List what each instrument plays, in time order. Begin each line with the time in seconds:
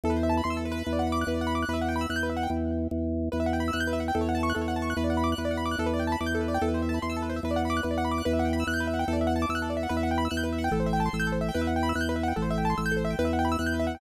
0.04 drawbar organ E2, acoustic grand piano A4
0.10 acoustic grand piano B4
0.16 acoustic grand piano C5
0.23 acoustic grand piano E5
0.29 acoustic grand piano A5
0.37 acoustic grand piano B5
0.44 drawbar organ E2, acoustic grand piano C6
0.50 acoustic grand piano E6
0.57 acoustic grand piano A4
0.65 acoustic grand piano B4
0.72 acoustic grand piano B4
0.86 drawbar organ E2
0.93 acoustic grand piano D5
0.99 acoustic grand piano F#5
1.07 acoustic grand piano B5
1.12 acoustic grand piano D6
1.21 acoustic grand piano F#6
1.27 drawbar organ E2, acoustic grand piano B4
1.34 acoustic grand piano D5
1.41 acoustic grand piano F#5
1.47 acoustic grand piano B5
1.55 acoustic grand piano D6
1.63 acoustic grand piano F#6
1.68 drawbar organ E2, acoustic grand piano B4
1.73 acoustic grand piano E5
1.81 acoustic grand piano F#5
1.88 acoustic grand piano G5
1.96 acoustic grand piano B5
2.01 acoustic grand piano E6
2.09 drawbar organ E2, acoustic grand piano F#6
2.16 acoustic grand piano G6
2.23 acoustic grand piano B4
2.30 acoustic grand piano E5
2.37 acoustic grand piano F#5
2.43 acoustic grand piano G5
2.50 drawbar organ E2
2.91 drawbar organ E2
3.32 drawbar organ E2, acoustic grand piano B4
3.40 acoustic grand piano E5
3.46 acoustic grand piano F#5
3.53 acoustic grand piano G5
3.60 acoustic grand piano B5
3.68 acoustic grand piano E6
3.73 drawbar organ E2, acoustic grand piano F#6
3.80 acoustic grand piano G6
3.87 acoustic grand piano B4
3.93 acoustic grand piano E5
4.00 acoustic grand piano F#5
4.08 acoustic grand piano G5
4.15 drawbar organ E2, acoustic grand piano A4
4.21 acoustic grand piano C#5
4.29 acoustic grand piano F#5
4.35 acoustic grand piano A5
4.43 acoustic grand piano C#6
4.50 acoustic grand piano F#6
4.55 drawbar organ E2, acoustic grand piano A4
4.61 acoustic grand piano C#5
4.68 acoustic grand piano F#5
4.76 acoustic grand piano A5
4.82 acoustic grand piano C#6
4.90 acoustic grand piano F#6
4.97 drawbar organ E2, acoustic grand piano B4
5.04 acoustic grand piano D5
5.10 acoustic grand piano F#5
5.17 acoustic grand piano B5
5.24 acoustic grand piano D6
5.32 acoustic grand piano F#6
5.38 drawbar organ E2, acoustic grand piano B4
5.45 acoustic grand piano D5
5.51 acoustic grand piano F#5
5.57 acoustic grand piano B5
5.66 acoustic grand piano D6
5.71 acoustic grand piano F#6
5.78 drawbar organ E2, acoustic grand piano A4
5.86 acoustic grand piano B4
5.93 acoustic grand piano D5
5.99 acoustic grand piano G5
6.07 acoustic grand piano A5
6.12 acoustic grand piano B5
6.20 drawbar organ E2, acoustic grand piano D6
6.26 acoustic grand piano G6
6.35 acoustic grand piano A4
6.41 acoustic grand piano B4
6.48 acoustic grand piano D5
6.54 acoustic grand piano G5
6.61 drawbar organ E2, acoustic grand piano A4
6.68 acoustic grand piano B4
6.74 acoustic grand piano C5
6.82 acoustic grand piano E5
6.89 acoustic grand piano A5
6.94 acoustic grand piano B5
7.02 drawbar organ E2, acoustic grand piano C6
7.10 acoustic grand piano E6
7.17 acoustic grand piano A4
7.22 acoustic grand piano B4
7.29 acoustic grand piano C5
7.36 acoustic grand piano E5
7.43 drawbar organ E2, acoustic grand piano B4
7.51 acoustic grand piano D5
7.56 acoustic grand piano F#5
7.65 acoustic grand piano B5
7.70 acoustic grand piano D6
7.77 acoustic grand piano F#6
7.83 drawbar organ E2, acoustic grand piano B4
7.91 acoustic grand piano D5
7.98 acoustic grand piano F#5
8.05 acoustic grand piano B5
8.11 acoustic grand piano D6
8.18 acoustic grand piano F#6
8.25 drawbar organ E2, acoustic grand piano B4
8.33 acoustic grand piano E5
8.39 acoustic grand piano F#5
8.45 acoustic grand piano G5
8.53 acoustic grand piano B5
8.60 acoustic grand piano E6
8.67 drawbar organ E2, acoustic grand piano F#6
8.74 acoustic grand piano G6
8.80 acoustic grand piano B4
8.87 acoustic grand piano E5
8.94 acoustic grand piano F#5
8.99 acoustic grand piano G5
9.08 drawbar organ E2, acoustic grand piano A4
9.13 acoustic grand piano D5
9.21 acoustic grand piano E5
9.27 acoustic grand piano F#5
9.36 acoustic grand piano A5
9.42 acoustic grand piano D6
9.49 drawbar organ E2, acoustic grand piano E6
9.55 acoustic grand piano F#6
9.62 acoustic grand piano A4
9.70 acoustic grand piano D5
9.77 acoustic grand piano E5
9.83 acoustic grand piano F#5
9.89 drawbar organ E2, acoustic grand piano B4
9.97 acoustic grand piano E5
10.03 acoustic grand piano F#5
10.11 acoustic grand piano G5
10.18 acoustic grand piano B5
10.25 acoustic grand piano E6
10.31 drawbar organ E2, acoustic grand piano F#6
10.37 acoustic grand piano G6
10.43 acoustic grand piano B4
10.53 acoustic grand piano E5
10.58 acoustic grand piano F#5
10.64 acoustic grand piano G5
10.71 drawbar organ A1, acoustic grand piano A4
10.80 acoustic grand piano C5
10.86 acoustic grand piano E5
10.93 acoustic grand piano G5
11.00 acoustic grand piano A5
11.06 acoustic grand piano C6
11.13 drawbar organ A1, acoustic grand piano E6
11.20 acoustic grand piano G6
11.27 acoustic grand piano A4
11.32 acoustic grand piano C5
11.41 acoustic grand piano E5
11.49 acoustic grand piano G5
11.54 drawbar organ E2, acoustic grand piano B4
11.61 acoustic grand piano E5
11.67 acoustic grand piano F#5
11.76 acoustic grand piano G5
11.83 acoustic grand piano B5
11.89 acoustic grand piano E6
11.95 drawbar organ E2, acoustic grand piano F#6
12.01 acoustic grand piano G6
12.09 acoustic grand piano B4
12.16 acoustic grand piano E5
12.23 acoustic grand piano F#5
12.28 acoustic grand piano G5
12.36 drawbar organ A1, acoustic grand piano A4
12.42 acoustic grand piano C5
12.50 acoustic grand piano E5
12.58 acoustic grand piano G5
12.65 acoustic grand piano A5
12.70 acoustic grand piano C6
12.78 drawbar organ A1, acoustic grand piano E6
12.86 acoustic grand piano G6
12.92 acoustic grand piano A4
12.97 acoustic grand piano C5
13.05 acoustic grand piano E5
13.10 acoustic grand piano G5
13.19 drawbar organ E2, acoustic grand piano B4
13.25 acoustic grand piano E5
13.33 acoustic grand piano F#5
13.39 acoustic grand piano G5
13.45 acoustic grand piano B5
13.52 acoustic grand piano E6
13.59 drawbar organ E2, acoustic grand piano F#6
13.66 acoustic grand piano G6
13.74 acoustic grand piano B4
13.80 acoustic grand piano E5
13.87 acoustic grand piano F#5
13.95 acoustic grand piano G5